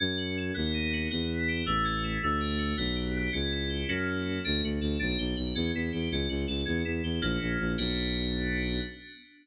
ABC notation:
X:1
M:6/8
L:1/8
Q:3/8=108
K:Bm
V:1 name="Electric Piano 2"
C F A B, ^D F | B, E G A, C E | A, D F B, G B, | C E G [^A,CEF]3 |
D F A D G B | C E G C F A | C E G [^A,CEF]3 | [B,DF]6 |]
V:2 name="Violin" clef=bass
F,,3 ^D,,3 | E,,3 A,,,3 | D,,3 B,,,3 | C,,3 F,,3 |
D,, D,, D,, B,,, B,,, B,,, | E,, E,, E,, C,, C,, C,, | E,, E,, E,, ^A,,, A,,, A,,, | B,,,6 |]